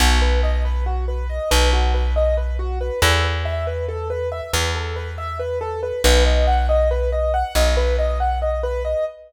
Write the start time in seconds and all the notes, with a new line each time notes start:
0.00 B1 F#4
0.22 B4
0.43 D#5
0.65 B4
0.86 F#4
1.08 B4
1.29 D#5
1.51 B1 B4
1.73 F#4
1.94 B4
2.16 D#5
2.37 B4
2.59 F#4
2.81 B4
3.02 E2 A4
3.24 B4
3.45 E5
3.67 B4
3.88 A4
4.10 B4
4.32 E5
4.53 E2 B4
4.75 A4
4.96 B4
5.18 E5
5.39 B4
5.61 A4
5.83 B4
6.04 B1 B4
6.26 D#5
6.47 F#5
6.69 D#5
6.91 B4
7.12 D#5
7.34 F#5
7.55 B1 D#5
7.77 B4
7.99 D#5
8.20 F#5
8.42 D#5
8.63 B4
8.85 D#5